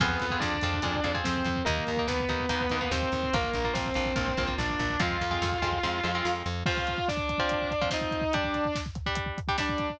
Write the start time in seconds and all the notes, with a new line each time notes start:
0.00 F2 B3 C4 F4 G#4 B4, kick, crash
0.10 kick
0.20 F2, kick, closed hi-hat
0.30 C4 F4 G#4, kick
0.40 F2 D4 D5, kick, snare
0.54 kick
0.61 F2 C4 F4 G#4, kick, closed hi-hat
0.74 kick
0.82 F2 C4 F4 G#4, kick, closed hi-hat
0.95 kick
1.04 F2 C4 F4 G#4, kick, closed hi-hat
1.14 C4 F4 G#4, kick
1.24 F2 C4 C5, kick, snare
1.36 kick
1.45 F2, kick, closed hi-hat
1.56 kick
1.65 D#2 A#3 D#4 A#4, kick, closed hi-hat
1.78 kick
1.87 D#2, kick, closed hi-hat
1.97 A#3 D#4, kick
2.07 D#2 B3 B4, kick, snare
2.20 kick
2.29 D#2 A#3 D#4, kick, closed hi-hat
2.40 kick
2.49 D#2 A#3 D#4, kick, closed hi-hat
2.61 kick
2.70 D#2 A#3 D#4, kick, closed hi-hat
2.81 A#3 D#4, kick
2.91 D#2 C4 C5, kick, snare
3.02 kick
3.12 D#2, kick, closed hi-hat
3.23 kick
3.33 A#1 A#3 F4 A#4, kick, closed hi-hat
3.43 kick
3.53 A#1, kick, closed hi-hat
3.64 A#3 F4, kick
3.73 A#1 C4 C5, kick, snare
3.86 kick
3.94 A#1 A#3 F4, kick, closed hi-hat
4.06 kick
4.16 A#1 A#3 F4, kick, closed hi-hat
4.28 kick
4.37 A#1 A#3 F4, kick, closed hi-hat
4.47 A#3 F4, kick
4.58 A#1 D4 D5, kick, snare
4.70 kick
4.79 A#1, kick, closed hi-hat
4.90 kick
5.00 F2 G#3 C4 F4 F5, kick, closed hi-hat
5.11 kick
5.21 F2, kick, closed hi-hat
5.31 G#3 C4 F4, kick
5.42 F2, kick, snare
5.52 kick
5.62 F2 G#3 C4 F4, kick, closed hi-hat
5.72 kick
5.83 F2 G#3 C4 F4, kick, snare
6.03 F2 G#3 C4 F4
6.15 G#3 C4 F4
6.25 F2, snare
6.46 F2
6.66 F3 C4 F4 F5, kick, crash
6.77 kick
6.87 kick, closed hi-hat
6.98 kick
7.08 D4 D5, kick, snare
7.17 kick
7.29 kick, closed hi-hat
7.38 F3 C4 F4, kick
7.49 kick, closed hi-hat
7.62 kick
7.71 kick, closed hi-hat
7.81 F3 C4 F4, kick
7.90 F3 C4 D#4 F4 D#5, kick, snare
8.01 kick
8.11 kick, closed hi-hat
8.21 kick
8.33 G3 D4 G4 D5, kick, closed hi-hat
8.44 kick
8.54 kick, closed hi-hat
8.65 kick
8.75 kick, snare
8.86 kick
8.95 kick, closed hi-hat
9.06 G3 D4 G4, kick
9.15 kick, closed hi-hat
9.26 kick
9.38 kick, closed hi-hat
9.48 G3 D4 G4, kick
9.58 G3 D4 G4 D5, kick, snare
9.69 kick
9.78 kick, closed hi-hat
9.90 kick